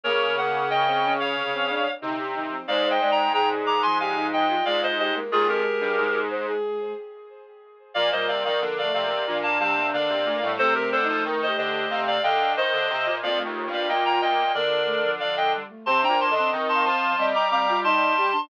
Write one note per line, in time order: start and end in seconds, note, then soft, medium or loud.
0.03 1.85 C#3 medium
0.03 0.34 A#3 medium
0.03 0.59 A#3 medium
0.03 0.35 A#4 medium
0.03 0.35 C#5 medium
0.37 0.65 A#3 medium
0.37 0.69 F#5 medium
0.69 1.34 C#3 medium
0.69 0.85 A#3 medium
0.69 1.13 D#5 medium
0.69 1.13 G5 medium
0.86 1.02 C4 medium
1.03 1.36 C#4 medium
1.20 1.91 C#5 medium
1.20 1.91 F5 medium
1.35 1.50 C3 medium
1.53 1.68 C4 medium
1.69 1.84 D4 medium
2.01 2.56 C3 medium
2.01 2.18 D3 medium
2.01 2.17 D#4 medium
2.18 2.34 G4 medium
2.35 2.51 D#3 medium
2.35 2.50 D#4 medium
2.49 2.65 F3 medium
2.49 2.66 C4 medium
2.68 4.55 G#2 medium
2.68 2.99 G#3 medium
2.68 2.84 C5 medium
2.68 2.88 D5 medium
2.68 2.88 F5 medium
2.85 3.00 C5 medium
2.90 3.11 D#5 medium
2.90 3.11 G5 medium
3.00 3.28 G#3 medium
3.00 3.16 D5 medium
3.11 3.32 G5 medium
3.11 3.32 A#5 medium
3.33 3.61 C3 medium
3.33 3.77 G#4 medium
3.33 3.49 G5 medium
3.33 3.49 A#5 medium
3.65 3.81 D#3 medium
3.65 3.82 A#5 medium
3.65 3.82 D6 medium
3.82 4.62 F3 medium
3.82 3.98 G#5 medium
3.82 3.98 C6 medium
4.00 4.16 G4 medium
4.00 4.27 F5 medium
4.00 4.27 G#5 medium
4.16 4.45 D#4 medium
4.33 4.65 D#5 medium
4.33 4.65 G5 medium
4.49 4.65 F4 medium
4.65 5.20 G#2 medium
4.65 5.12 G#3 medium
4.65 4.94 F4 medium
4.65 4.81 D5 medium
4.65 4.81 F5 medium
4.83 4.98 C5 medium
4.83 4.98 D#5 medium
4.98 5.14 G4 medium
4.98 5.14 C5 medium
4.98 5.14 D#5 medium
5.14 5.30 G#3 medium
5.14 5.30 A#3 medium
5.31 5.47 D#2 medium
5.31 5.80 G#3 medium
5.31 5.47 F4 medium
5.31 6.26 G#4 medium
5.31 5.47 G#4 medium
5.48 5.63 F2 medium
5.48 6.20 G4 medium
5.48 6.20 A#4 medium
5.81 5.96 G2 medium
5.81 5.98 G3 medium
5.97 6.52 G#2 medium
5.97 6.94 G#3 medium
6.30 6.46 C5 medium
6.47 6.92 G#4 medium
7.94 8.11 A#2 medium
7.94 8.10 F3 medium
7.94 8.48 A#3 medium
7.94 8.10 D5 medium
7.94 8.10 F5 medium
8.12 8.27 A#2 medium
8.12 8.44 G3 medium
8.12 8.27 C5 medium
8.12 8.27 D#5 medium
8.28 8.44 C3 medium
8.28 8.43 D5 medium
8.28 8.43 F5 medium
8.45 8.60 D#3 medium
8.45 8.61 F3 medium
8.45 8.60 D5 medium
8.45 8.60 F5 medium
8.60 8.88 D3 medium
8.60 9.14 F3 medium
8.60 8.81 A#3 medium
8.78 8.93 D5 medium
8.78 8.93 F5 medium
8.83 9.04 A3 medium
8.94 9.23 C3 medium
8.94 9.38 D5 medium
8.94 9.38 F5 medium
9.05 9.26 A#3 medium
9.27 9.58 A#2 medium
9.27 9.44 F3 medium
9.27 10.35 D4 medium
9.43 9.58 F5 medium
9.43 9.58 A5 medium
9.59 9.92 C3 medium
9.59 9.75 G3 medium
9.59 9.87 F5 medium
9.59 9.87 A5 medium
9.76 9.92 A#3 medium
9.93 10.09 D3 medium
9.93 10.23 A#3 medium
9.93 10.52 D5 medium
9.93 10.52 F5 medium
10.09 10.25 C3 medium
10.25 10.41 A#2 medium
10.25 10.41 A3 medium
10.42 10.58 A2 medium
10.42 10.58 G3 medium
10.58 10.74 C3 medium
10.58 12.19 A3 medium
10.58 10.98 C4 medium
10.58 10.74 A4 medium
10.58 10.74 C5 medium
10.74 10.91 C3 medium
10.74 10.90 G4 medium
10.74 10.90 A#4 medium
10.92 11.07 D3 medium
10.92 11.07 A4 medium
10.92 11.07 C5 medium
11.02 11.38 D#4 medium
11.08 11.24 F3 medium
11.08 11.23 A4 medium
11.08 11.23 C5 medium
11.25 11.51 D#3 medium
11.42 11.57 C5 medium
11.42 11.57 D#5 medium
11.47 11.85 G4 medium
11.57 11.87 D3 medium
11.57 12.01 C5 medium
11.57 12.01 D#5 medium
11.90 12.17 C3 medium
11.90 12.19 F5 medium
12.07 12.23 D5 medium
12.07 12.23 F5 medium
12.23 12.55 D3 medium
12.23 12.52 D#5 medium
12.23 12.54 F5 medium
12.23 12.52 G5 medium
12.57 12.72 D#3 medium
12.57 12.85 C5 medium
12.57 13.16 C5 medium
12.57 13.16 D#5 medium
12.73 12.89 D3 medium
12.90 13.05 C3 medium
13.06 13.22 A#2 medium
13.22 13.43 F2 medium
13.22 13.39 A#3 medium
13.22 14.33 F4 medium
13.22 13.39 D5 medium
13.22 13.39 F5 medium
13.37 13.66 A3 medium
13.45 13.65 D#2 medium
13.66 13.87 G2 medium
13.71 13.87 A#3 medium
13.71 13.88 D5 medium
13.71 13.88 F5 medium
13.88 14.19 A#2 medium
13.88 14.45 A#3 medium
13.88 14.04 D#5 medium
13.88 14.04 G5 medium
14.05 14.21 G5 medium
14.05 14.21 A#5 medium
14.21 14.52 A#2 medium
14.21 14.52 D#5 medium
14.21 14.52 G5 medium
14.54 15.62 D3 medium
14.54 14.72 A#3 medium
14.54 15.11 A#4 medium
14.54 15.11 D5 medium
14.85 15.01 A3 medium
15.04 15.19 F3 medium
15.20 15.53 F3 medium
15.20 15.35 D5 medium
15.20 15.35 F5 medium
15.37 15.52 D#5 medium
15.37 15.52 G5 medium
15.55 15.70 G3 medium
15.69 15.85 A3 medium
15.86 16.07 C3 medium
15.86 16.03 C4 medium
15.86 16.24 C5 medium
15.86 16.02 A5 medium
15.86 16.02 C6 medium
16.02 16.29 D4 medium
16.02 16.19 G5 medium
16.02 16.19 A#5 medium
16.09 16.29 A#2 medium
16.20 16.34 A5 medium
16.20 16.34 C6 medium
16.30 16.51 D3 medium
16.30 16.68 D#5 medium
16.35 16.52 C4 medium
16.35 16.50 A5 medium
16.35 16.50 C6 medium
16.52 16.84 D#3 medium
16.52 17.13 C4 medium
16.69 16.84 A5 medium
16.69 16.84 C6 medium
16.75 17.12 F5 medium
16.85 17.16 F3 medium
16.85 17.26 A5 medium
16.85 17.26 C6 medium
17.18 18.30 G3 medium
17.18 17.34 C4 medium
17.18 17.45 D#5 medium
17.35 17.50 A#5 medium
17.35 17.50 D6 medium
17.50 17.66 C4 medium
17.50 17.80 F5 medium
17.50 17.79 A#5 medium
17.50 17.79 D6 medium
17.69 17.85 F4 medium
17.84 18.14 D#4 medium
17.84 18.12 D#5 medium
17.84 18.41 A5 medium
17.84 18.41 C6 medium
18.18 18.33 G4 medium
18.32 18.48 D4 medium